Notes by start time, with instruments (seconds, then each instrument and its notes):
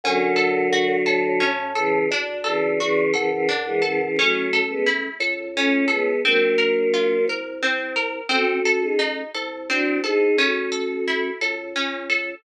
0.04 drawbar organ F#2, choir aahs D3 F#3, harpsichord C#4
0.36 harpsichord A4
0.73 harpsichord F#4
1.06 drawbar organ A2, harpsichord A4
1.40 harpsichord C#4
1.75 choir aahs C#3 E3, harpsichord A4
2.11 drawbar organ D2, harpsichord D4
2.44 choir aahs C#3 E3, harpsichord A4
2.79 choir aahs C#3 E3, harpsichord F#4
3.13 drawbar organ F#2, choir aahs C#3 E3, harpsichord A4
3.31 choir aahs C#3 E3
3.49 harpsichord D4
3.66 choir aahs E3 G#3
3.82 choir aahs C#3 E3, harpsichord A4
4.01 choir aahs C#3 E3
4.16 drawbar organ A1, choir aahs F#3 A3, harpsichord C#4
4.53 harpsichord A4
4.69 choir aahs G#3 B3
4.86 harpsichord E4
5.20 drawbar organ C#2, harpsichord A4
5.55 choir aahs A3 C#4, harpsichord C#4
5.88 choir aahs G#3 B3, harpsichord A4
6.24 drawbar organ A#1, choir aahs F#3 A#3, harpsichord C4
6.58 harpsichord A#4
6.94 harpsichord F4
7.28 drawbar organ C2, harpsichord A#4
7.62 harpsichord C4
7.96 harpsichord A#4
8.29 drawbar organ A1, harpsichord C4, choir aahs F#4 A4
8.65 harpsichord A4
8.82 choir aahs D#4 G#4
8.99 harpsichord D#4
9.34 drawbar organ C2, harpsichord A4
9.69 harpsichord C4, choir aahs D4 F#4
10.04 choir aahs D#4 G#4, harpsichord A4
10.37 drawbar organ A1, harpsichord C#4, choir aahs F#4 A4
10.72 harpsichord A4
11.07 harpsichord E4
11.41 drawbar organ C#2, harpsichord A4
11.76 harpsichord C#4
12.10 harpsichord A4